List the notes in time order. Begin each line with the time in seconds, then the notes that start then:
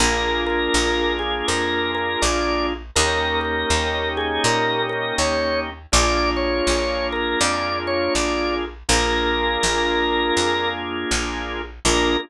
0.00 A#1 A#3 D4 F4 G#4 A#4
0.46 A#4
0.74 A#1
1.19 G#4
1.48 F2 A#4
1.95 A#4
2.22 A#1 D5
2.96 D#2 A#3 C#4 D#4 G4 A#4
3.41 A#4
3.70 D#2
4.17 G#4
4.44 A#2 A#4
4.89 A#4
5.18 D#2 C#5
5.92 A#1 A#3 D4 F4 G#4 D5
6.37 C#5
6.67 A#1
7.12 A#4
7.40 F2 D5
7.87 C#5
8.15 A#1 D5
8.89 A#1 A#3 D4 F4 G#4 A#4
9.63 A#1
10.37 F2
11.11 A#1
11.85 A#1 A#3 D4 F4 G#4 A#4